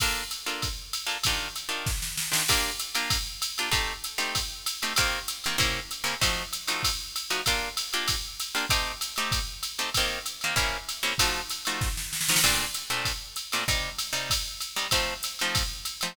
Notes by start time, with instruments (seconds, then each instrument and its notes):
0.00 acoustic guitar (steel) A#3 D4 F4 A4, kick, crash, ride
0.31 hi-hat pedal, ride
0.46 acoustic guitar (steel) A#3 D4 F4 A4, ride
0.62 kick, ride
0.93 hi-hat pedal, ride
1.07 acoustic guitar (steel) A#3 D4 F4 A4, ride
1.24 acoustic guitar (steel) D#3 D4 F4 G4, kick, ride
1.56 hi-hat pedal, ride
1.69 acoustic guitar (steel) D#3 D4 F4 G4, ride
1.86 kick, snare
2.02 snare
2.17 snare
2.32 acoustic guitar (steel) D#3 D4 F4 G4, snare
2.48 acoustic guitar (steel) A#3 D4 F4 G4, kick, crash, ride
2.80 hi-hat pedal, ride
2.95 acoustic guitar (steel) A#3 D4 F4 G4, ride
3.10 kick, ride
3.42 hi-hat pedal, ride
3.58 acoustic guitar (steel) A#3 D4 F4 G4, ride
3.72 acoustic guitar (steel) A3 C4 D#4 G4, kick, ride
4.04 hi-hat pedal, ride
4.18 acoustic guitar (steel) A3 C4 D#4 G4, ride
4.35 kick, ride
4.66 hi-hat pedal, ride
4.82 acoustic guitar (steel) A3 C4 D#4 G4, ride
4.96 acoustic guitar (steel) D#3 A#3 C4 G4, kick, ride
5.28 hi-hat pedal, ride
5.44 acoustic guitar (steel) D#3 A#3 C4 G4, ride
5.58 acoustic guitar (steel) C3 A#3 C#4 E4, kick, ride
5.91 hi-hat pedal, ride
6.04 acoustic guitar (steel) C3 A#3 C#4 E4, ride
6.21 acoustic guitar (steel) F3 A3 D#4 F#4, kick, ride
6.53 hi-hat pedal, ride
6.67 acoustic guitar (steel) F3 A3 D#4 F#4, ride
6.83 kick, ride
7.16 hi-hat pedal, ride
7.30 acoustic guitar (steel) F3 A3 D#4 F#4, ride
7.46 acoustic guitar (steel) A#3 D4 F4 G4, kick, ride
7.77 hi-hat pedal, ride
7.93 acoustic guitar (steel) A#3 D4 F4 G4, ride
8.08 kick, ride
8.40 hi-hat pedal, ride
8.55 acoustic guitar (steel) A#3 D4 F4 G4, ride
8.69 acoustic guitar (steel) A3 C4 D#4 G4, kick, ride
9.01 hi-hat pedal, ride
9.16 acoustic guitar (steel) A3 C4 D#4 G4, ride
9.32 kick, ride
9.63 hi-hat pedal, ride
9.78 acoustic guitar (steel) A3 C4 D#4 G4, ride
9.94 acoustic guitar (steel) D#3 A#3 C4 G4, kick, ride
10.26 hi-hat pedal, ride
10.41 acoustic guitar (steel) D#3 A#3 C4 G4, ride
10.56 acoustic guitar (steel) C3 A#3 C#4 E4, kick, ride
10.89 hi-hat pedal, ride
11.03 acoustic guitar (steel) C3 A#3 C#4 E4, ride
11.18 acoustic guitar (steel) F3 A3 D#4 F#4, kick, ride
11.50 hi-hat pedal, ride
11.65 acoustic guitar (steel) F3 A3 D#4 F#4, ride
11.81 kick, snare
11.97 snare
12.13 snare
12.21 snare
12.28 acoustic guitar (steel) F3 A3 D#4 F#4, snare
12.36 snare
12.44 acoustic guitar (steel) A#2 A3 C4 D4, kick, crash, ride
12.74 hi-hat pedal, ride
12.90 acoustic guitar (steel) A#2 A3 C4 D4, ride
13.05 kick, ride
13.36 hi-hat pedal, ride
13.52 acoustic guitar (steel) A#2 A3 C4 D4, ride
13.68 acoustic guitar (steel) C3 G3 D#4, kick, ride
13.99 hi-hat pedal, ride
14.13 acoustic guitar (steel) C3 G3 D#4, ride
14.30 kick, ride
14.60 hi-hat pedal, ride
14.76 acoustic guitar (steel) C3 G3 D#4, ride
14.91 acoustic guitar (steel) F3 A3 C4 D#4, kick, ride
15.23 hi-hat pedal, ride
15.39 acoustic guitar (steel) F3 A3 C4 D#4, ride
15.55 kick, ride
15.85 hi-hat pedal, ride
16.01 acoustic guitar (steel) F3 A3 C4 D#4, ride